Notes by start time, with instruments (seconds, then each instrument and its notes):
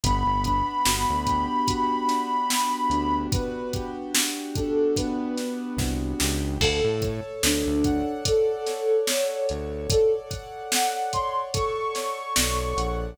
0.03 synth bass 1 G1, acoustic grand piano B3, ocarina B5, kick, closed hi-hat
0.26 synth bass 1 G1
0.44 acoustic grand piano D4, kick, closed hi-hat
0.85 synth bass 1 G1, acoustic grand piano F#4, snare
1.10 synth bass 1 D2
1.26 acoustic grand piano G4, kick, closed hi-hat
1.67 acoustic grand piano F#4, kick, closed hi-hat
2.08 acoustic grand piano D4, snare, closed hi-hat
2.49 acoustic grand piano B3, snare
2.90 synth bass 1 D2, acoustic grand piano D4, closed hi-hat
3.32 acoustic grand piano F#4, ocarina B4, kick, closed hi-hat
3.73 acoustic grand piano G4, kick, closed hi-hat
4.14 acoustic grand piano F#4, snare
4.55 acoustic grand piano D4, ocarina A4, kick, closed hi-hat
4.96 acoustic grand piano B3, ocarina B4, kick, closed hi-hat
5.37 acoustic grand piano D4, snare, closed hi-hat
5.77 synth bass 1 C2, acoustic grand piano F#4, kick, snare
6.19 synth bass 1 C#2, acoustic grand piano G4, snare
6.61 synth bass 1 D2, ocarina A4, acoustic grand piano A4, kick, crash
6.84 synth bass 1 A2
7.02 acoustic grand piano C#5, kick, closed hi-hat
7.43 synth bass 1 D2, ocarina D4, acoustic grand piano D5, snare
7.67 synth bass 1 D2
7.84 acoustic grand piano F#5, kick, closed hi-hat
8.25 ocarina A4, acoustic grand piano D5, kick, closed hi-hat
8.66 acoustic grand piano C#5, snare, closed hi-hat
9.07 acoustic grand piano A4, ocarina C#5, snare
9.49 synth bass 1 D2, acoustic grand piano C#5, closed hi-hat
9.90 ocarina A4, acoustic grand piano D5, kick, closed hi-hat
10.30 acoustic grand piano F#5, kick, closed hi-hat
10.72 acoustic grand piano D5, ocarina F#5, snare
11.13 acoustic grand piano C#5, ocarina C6, kick, closed hi-hat
11.54 acoustic grand piano A4, ocarina C#6, kick, closed hi-hat
11.95 acoustic grand piano C#5, snare, closed hi-hat
12.36 synth bass 1 B1, acoustic grand piano D5, snare
12.77 synth bass 1 A#1, acoustic grand piano F#5, closed hi-hat